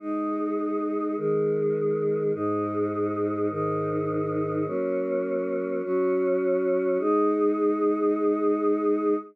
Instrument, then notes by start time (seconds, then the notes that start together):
choir aahs
0.00 G#3 D#4 G#4
1.17 D#3 G#3 G#4
2.33 G#2 G#3 D#4
3.50 G#2 D#3 D#4
4.66 F#3 A#3 C#4
5.83 F#3 C#4 F#4
6.99 G#3 D#4 G#4